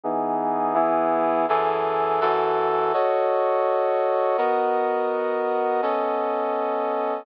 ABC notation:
X:1
M:4/4
L:1/8
Q:"Swing" 1/4=166
K:F#dor
V:1 name="Brass Section"
[E,B,DG]4 [E,B,EG]4 | [F,,E,GA]4 [F,,E,FA]4 | [FAcd]8 | [B,F^Ad]8 |
[B,CAd]8 |]